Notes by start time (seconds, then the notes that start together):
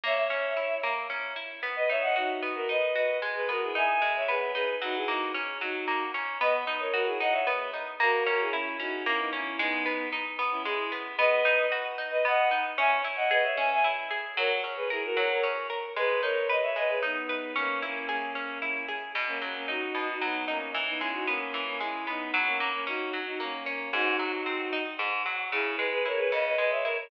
0.04 A#3 C#5 E5
0.17 C#5 E5
0.30 C#4
0.57 E4
0.83 A#3
1.10 C#4
1.36 E4
1.63 B3
1.76 B4 D#5
1.89 D#4 C#5 E5
2.02 D#5 F#5
2.16 D#4 F#4
2.42 B3
2.55 F#4 A#4
2.69 D#4 B4 D#5
2.95 F#4 B4 D#5
3.22 G#3
3.35 G#4 B4
3.49 B3 F#4 A#4
3.62 E4 G#4
3.75 D#4 E5 G#5
4.02 G#3
4.16 C#5 E5
4.28 B3 G#4 B4
4.54 D#4 G#4 B4
4.82 F#3 D#4 F#4
4.96 E4 G#4
5.07 A#3 D#4 F#4
5.35 C#4
5.60 F#3 D#4 F#4
5.88 A#3
6.14 C#4
6.41 B3 B4 D#5
6.67 D#4
6.80 A#4 C#5
6.93 F#4 A#4
7.06 E4 G#4
7.20 D#4 D#5 F#5
7.32 C#5 E5
7.47 B3
7.74 D#4
8.00 A#3 F#4 A#4
8.26 C#4 F#4 A#4
8.40 E4 G#4
8.52 C#4 E4
8.79 C#4 D#4 F#4
9.05 A#3 C#4 E4
9.19 B3 D#4
9.33 C#4 E4
9.59 G#3 B3 D#4
9.86 B3
10.12 D#4
10.39 B3
10.51 C#4 E4
10.65 G#3 E4 G#4
10.92 B3
11.18 B3 B4 D#5
11.45 D#4
11.72 F#4
11.98 D#4
12.11 B4 D#5
12.25 B3 D#5 F#5
12.51 D#4
12.78 C#4 E5 G#5
13.04 E4
13.16 D#5 F#5
13.31 G#4 B4 D#5
13.44 C#5 E5
13.57 C#4 E5 G#5
13.72 E5 G#5
13.84 E4
14.11 G#4
14.37 F#3 A#4 C#5
14.64 C#4
14.76 G#4 B4
14.90 E4 G#4 A#4
15.04 F#4 A#4
15.15 F#3 A#4 C#5
15.30 A#4 C#5
15.43 C#4
15.70 A#4
15.96 G#3 G#4 B4
16.21 D#4 A#4 C#5
16.49 B4 D#5
16.62 C#5 E5
16.76 G#3 B4 D#5
16.89 G#4 B4
17.03 B3 D#4
17.29 B4
17.56 A#3 C#4
17.82 A#3 C#4 E4
18.09 A#3 C#4 G#4
18.35 C#4
18.62 E4
18.88 G#4
19.15 B2
19.27 A#3 C#4
19.41 F#3 A#3 C#4
19.56 A#3 C#4
19.68 D#4 F#4
19.95 B2
20.08 D#4 F#4
20.21 F#3 B3 D#4
20.48 A#3 C#4 D#4
20.74 E3
20.87 B3 D#4
20.99 G#3 C#4 E4
21.13 D#4 F#4
21.27 A#3 B3 C#4
21.54 E3
21.67 A#3 C#4
21.80 G#3 C#4 E4
22.07 B3 D#4
22.34 F#3
22.46 A#3 C#4
22.60 A#3 C#4
22.73 A#3 C#4
22.87 C#4 D#4 F#4
23.13 F#3
23.25 D#4 F#4
23.40 A#3 C#4
23.66 A#3 C#4
23.93 G#2 D#4 F#4
24.19 F#3
24.46 C4
24.73 D#4
24.99 G#2
25.26 F#3
25.52 C#3 E4 G#4
25.77 G#3 G#4 B4
25.92 G#4 B4
26.05 E4 A#4 C#5
26.18 G#4 B4
26.32 C#3 B4 D#5
26.46 B4 D#5
26.58 G#3 B4 D#5
26.71 C#5 E5
26.84 E4 A#4 C#5
26.97 A#4 C#5